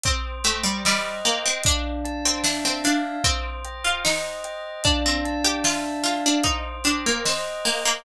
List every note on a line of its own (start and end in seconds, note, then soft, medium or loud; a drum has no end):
0.04 0.38 C4 medium
0.04 1.57 C5 loud
0.04 kick loud
0.04 closed hi-hat loud
0.44 0.64 A3 medium
0.44 1.25 G5 medium
0.44 closed hi-hat medium
0.64 0.83 G3 medium
0.85 1.20 G3 medium
0.85 1.61 D#5 medium
0.85 snare loud
1.25 1.44 A#3 medium
1.25 1.63 G5 medium
1.25 closed hi-hat medium
1.46 1.65 C4 medium
1.64 3.17 D4 medium
1.64 2.24 D4 medium
1.64 kick loud
1.64 closed hi-hat loud
2.05 3.19 A5 medium
2.05 closed hi-hat medium
2.25 2.44 C4 medium
2.44 2.63 D4 medium
2.44 3.21 E5 medium
2.44 snare loud
2.65 2.84 C4 medium
2.84 3.17 D4 medium
2.84 3.23 F5 medium
2.84 snare medium
2.84 closed hi-hat medium
3.24 3.61 C4 medium
3.24 4.77 C5 loud
3.24 kick loud
3.24 closed hi-hat loud
3.65 4.44 G5 medium
3.65 closed hi-hat medium
3.84 4.03 F4 medium
4.05 4.73 D#4 medium
4.05 4.81 D#5 medium
4.05 snare loud
4.44 4.83 G5 medium
4.44 closed hi-hat medium
4.84 5.04 D4 medium
4.84 6.37 D4 loud
4.84 kick loud
4.84 closed hi-hat loud
5.06 5.40 C4 medium
5.25 6.39 A5 medium
5.25 closed hi-hat medium
5.45 5.64 G4 medium
5.64 5.84 F4 medium
5.64 6.41 E5 medium
5.64 snare loud
6.04 6.23 F4 medium
6.04 6.43 F5 medium
6.04 snare medium
6.04 closed hi-hat medium
6.26 6.45 D4 medium
6.44 6.77 D#4 medium
6.44 7.97 C5 loud
6.44 kick medium
6.44 closed hi-hat loud
6.84 7.04 D4 medium
6.84 7.65 G5 medium
6.84 closed hi-hat medium
7.06 7.25 A#3 medium
7.25 7.62 C4 medium
7.25 8.01 D#5 medium
7.25 snare loud
7.65 7.84 A#3 medium
7.65 8.03 G5 medium
7.65 open hi-hat medium
7.85 8.04 A#3 medium